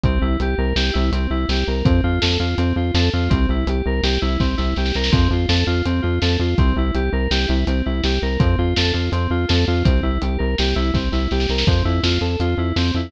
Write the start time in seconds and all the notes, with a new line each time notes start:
0.03 C2 C4, kick, closed hi-hat
0.22 C2 E4
0.40 C2 G4, closed hi-hat
0.58 C2 A#4
0.76 C2 G4, snare
0.93 C2 E4
1.12 C2 C4, closed hi-hat
1.30 C2 E4
1.49 C2 G4, snare
1.67 C2 A#4
1.85 F2 C4, kick, closed hi-hat
2.04 F2 F4
2.21 F2 A4, snare
2.39 F2 F4
2.58 F2 C4, closed hi-hat
2.76 F2 F4
2.94 F2 A4, snare
3.13 F2 F4
3.30 C2 C4, kick, closed hi-hat
3.49 C2 E4
3.67 C2 G4, closed hi-hat
3.86 C2 A#4
4.03 C2 G4, snare
4.22 C2 E4
4.40 C2 C4, kick, snare
4.57 C2 E4, snare
4.76 C2 G4, snare
4.86 snare
4.94 C2 A#4, snare
5.04 snare
5.12 F2 C4, kick, closed hi-hat
5.31 F2 F4
5.49 F2 A4, snare
5.67 F2 F4
5.85 F2 C4, closed hi-hat
6.02 F2 F4
6.22 F2 A4, snare
6.39 F2 F4
6.58 C2 C4, kick, closed hi-hat
6.76 C2 E4
6.94 C2 G4, closed hi-hat
7.13 C2 A#4
7.31 C2 G4, snare
7.48 C2 E4
7.67 C2 C4, closed hi-hat
7.86 C2 E4
8.03 C2 G4, snare
8.22 C2 A#4
8.39 F2 C4, kick, closed hi-hat
8.58 F2 F4
8.76 F2 A4, snare
8.93 F2 F4
9.12 F2 C4, closed hi-hat
9.30 F2 F4
9.48 F2 A4, snare
9.67 F2 F4
9.84 C2 C4, kick, closed hi-hat
10.03 C2 E4
10.22 C2 G4, closed hi-hat
10.38 C2 A#4
10.58 C2 G4, snare
10.75 C2 E4
10.94 C2 C4, kick, snare
11.12 C2 E4, snare
11.31 C2 G4, snare
11.40 snare
11.49 C2 A#4, snare
11.58 snare
11.67 F2 C4, kick, closed hi-hat
11.85 F2 E4
12.03 F2 F4, snare
12.21 F2 A4
12.40 F2 F4, closed hi-hat
12.57 F2 E4
12.76 F2 C4, snare
12.94 F2 E4